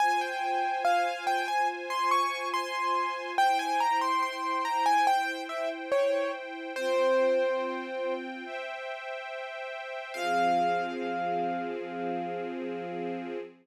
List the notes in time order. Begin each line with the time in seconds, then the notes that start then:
0.00 F4 C5 G#5
0.21 G5
0.85 F5
1.27 G5
1.48 G#5
1.90 C6
2.11 C#6
2.54 C6
3.38 E4 C5 G5
3.59 G#5
3.80 A#5
4.01 C6
4.23 C6
4.65 A#5
4.86 G#5
5.07 G5
5.49 E5
5.92 C#5
6.76 C4 F4 C5 G5
8.45 C5 E5 G5
10.14 F3 C4 G#4 F5